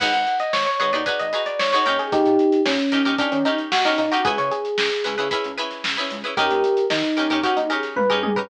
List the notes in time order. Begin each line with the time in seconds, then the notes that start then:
0.00 G#1 D#4 F#4 G#4 B4 F#5, kick, crash
0.13 G#1 F#5, closed hi-hat
0.27 closed hi-hat
0.39 D#5, closed hi-hat
0.53 G#1 C#5, snare
0.66 C#5, closed hi-hat
0.80 G#1 D#4 F#4 G#4 B4 C#5, closed hi-hat
0.93 D#2 D#4 F#4 G#4 B4 D5, closed hi-hat
1.06 D#4 F#4 G#4 B4, kick, closed hi-hat
1.19 G#1 D#5, closed hi-hat
1.33 D#4 F#4 G#4 B4, snare, closed hi-hat
1.46 D5, closed hi-hat
1.59 G#1 C#5, snare
1.73 D#4 F#4 G#4 B4 C#5, snare, closed hi-hat
1.86 D#2 C#4 D#4 G4 A#4, closed hi-hat
1.99 G#4, closed hi-hat
2.12 D#2 D#4 G4, kick, closed hi-hat
2.26 A#2, closed hi-hat
2.39 closed hi-hat
2.52 closed hi-hat
2.65 A#2 C#4, snare
2.79 closed hi-hat
2.92 D#3 C#4 D#4 G4 A#4, closed hi-hat
3.05 D#2 C#4 D#4 G4 A#4, closed hi-hat
3.18 C#4 D4 D#4 G4 A#4, kick, closed hi-hat
3.32 D#3 C#4, closed hi-hat
3.45 C#4 D#4 G4 A#4, closed hi-hat
3.58 closed hi-hat
3.72 D#2 F#4, snare
3.85 C#4 D#4 G4 A#4, snare, closed hi-hat
3.98 A#2 D#4, closed hi-hat
4.12 C#4 D#4 F#4 G4 A#4, closed hi-hat
4.25 C#2 C#4 E4 G#4 B4, kick, closed hi-hat
4.38 C#3 C#5, closed hi-hat
4.51 G#4, closed hi-hat
4.65 closed hi-hat
4.78 C#2, snare
4.91 snare, closed hi-hat
5.04 C#2 C#4 E4 G#4 B4, closed hi-hat
5.18 C#3 C#4 E4 G#4 B4, closed hi-hat
5.31 C#4 E4 G#4 B4, kick, closed hi-hat
5.44 C#2, closed hi-hat
5.58 C#4 E4 G#4 B4, snare, closed hi-hat
5.71 snare, closed hi-hat
5.84 C#2, snare
5.97 C#4 E4 G#4 B4, snare, closed hi-hat
6.10 C#2, closed hi-hat
6.24 C#4 E4 G#4 B4, closed hi-hat
6.37 D#2 C#4 D#4 G4 A#4, kick, closed hi-hat
6.50 D#2, closed hi-hat
6.64 closed hi-hat
6.77 closed hi-hat
6.90 D#3 D#4, snare
7.04 closed hi-hat
7.17 D#2 C#4 D#4 G4 A#4, closed hi-hat
7.30 D#2 C#4 D#4 G4 A#4, closed hi-hat
7.43 C#4 D#4 F#4 G4 A#4, kick, closed hi-hat
7.57 D#2 D#4, closed hi-hat
7.70 C#4 D#4 G4 G#4 A#4, closed hi-hat
7.83 snare, closed hi-hat
7.96 A#2 B4, kick, high tom
8.10 C#4 D#4 G4 G#4 A#4, floor tom
8.23 D#2 G#4, high tom
8.36 C#4 D#4 G4 A#4 B4, floor tom